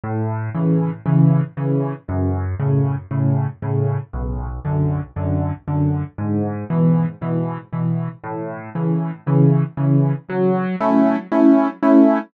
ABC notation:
X:1
M:4/4
L:1/8
Q:1/4=117
K:F#m
V:1 name="Acoustic Grand Piano"
A,,2 [C,E,]2 [C,E,]2 [C,E,]2 | F,,2 [A,,C,]2 [A,,C,]2 [A,,C,]2 | B,,,2 [F,,D,]2 [F,,D,]2 [F,,D,]2 | G,,2 [B,,E,]2 [B,,E,]2 [B,,E,]2 |
A,,2 [C,E,]2 [C,E,]2 [C,E,]2 | F,2 [A,CE]2 [A,CE]2 [A,CE]2 |]